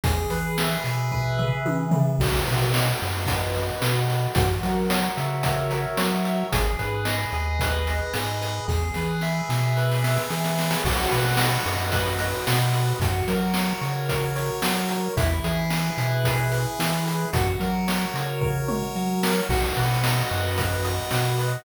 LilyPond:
<<
  \new Staff \with { instrumentName = "Lead 1 (square)" } { \time 4/4 \key b \major \tempo 4 = 111 gis'8 b'8 e''8 gis'8 b'8 e''8 gis'8 b'8 | fis'8 b'8 dis''8 fis'8 b'8 dis''8 fis'8 b'8 | fis'8 ais'8 cis''8 e''8 fis'8 ais'8 cis''8 e''8 | gis'8 b'8 dis''8 gis'8 b'8 dis''8 gis'8 b'8 |
gis'8 b'8 e''8 gis'8 b'8 e''8 gis'8 b'8 | fis'8 b'8 dis''8 fis'8 b'8 dis''8 fis'8 b'8 | fis'8 ais'8 cis''8 fis'8 ais'8 cis''8 fis'8 ais'8 | e'8 gis'8 b'8 e'8 gis'8 b'8 e'8 gis'8 |
fis'8 ais'8 cis''8 fis'8 ais'8 cis''8 fis'8 ais'8 | fis'8 b'8 dis''8 fis'8 b'8 dis''8 fis'8 b'8 | }
  \new Staff \with { instrumentName = "Synth Bass 1" } { \clef bass \time 4/4 \key b \major e,8 e4 b,4. e4 | b,,8 b,4 fis,4. b,4 | fis,8 fis4 cis4. fis4 | gis,,8 gis,4 dis,4. gis,4 |
e,8 e4 b,4. e4 | b,,8 b,4 fis,4. b,4 | fis,8 fis4 cis4. fis4 | e,8 e4 b,4. e4 |
fis,8 fis4 cis4. fis4 | b,,8 b,4 fis,4. b,4 | }
  \new DrumStaff \with { instrumentName = "Drums" } \drummode { \time 4/4 <hh bd>8 hh8 sn8 hh8 bd8 tomfh8 tommh8 tomfh8 | <cymc bd>8 hh8 sn8 hh8 <hh bd>8 hh8 sn8 hh8 | <hh bd>8 hh8 sn8 hh8 <hh bd>8 hh8 sn8 hh8 | <hh bd>8 hh8 sn8 hh8 <hh bd>8 hh8 sn8 hh8 |
<bd sn>8 sn8 sn8 sn8 sn16 sn16 sn16 sn16 sn16 sn16 sn16 sn16 | <cymc bd>8 hh8 sn8 hh8 <hh bd>8 hh8 sn8 hh8 | <hh bd>8 hh8 sn8 hh8 <hh bd>8 hh8 sn8 hh8 | <hh bd>8 hh8 sn8 hh8 <hh bd>8 hh8 sn8 hh8 |
<hh bd>8 hh8 sn8 hh8 <bd tomfh>8 toml8 r8 sn8 | <cymc bd>8 hh8 sn8 hh8 <hh bd>8 hh8 sn8 hh8 | }
>>